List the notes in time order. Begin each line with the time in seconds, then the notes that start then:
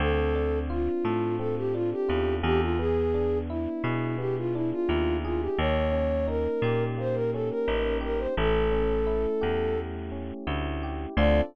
0.00 D2 C4 A4
0.35 D4
0.70 F4
1.05 A2 A4
1.39 C4 A4
1.57 G4
1.73 D4 F4
1.92 G4
2.08 E2 F4
2.43 E2 G4 A4
2.61 F4
2.79 B3 G#4
3.14 D4
3.49 E4
3.84 B2 G#4
4.18 B3 G4
4.37 F4
4.54 D4 E4
4.72 F4
4.89 D#2 E4
5.25 F4 G#4
5.41 G4
5.58 D#2 A#3 C#5
5.92 C#4
6.28 D#4 A#4
6.62 A#2 G4
6.98 A#3 C5
7.14 A#4
7.33 C#4 A4
7.50 A#4
7.68 A1 D#4
8.01 G4 A#4
8.18 C5
8.37 A1 A3 A4
8.72 C#4
9.07 E4
9.41 E2 G4
9.76 A3
10.12 C#4
10.47 D2 E4
10.83 G4
11.16 D2 C4 D4 F4 A4 D5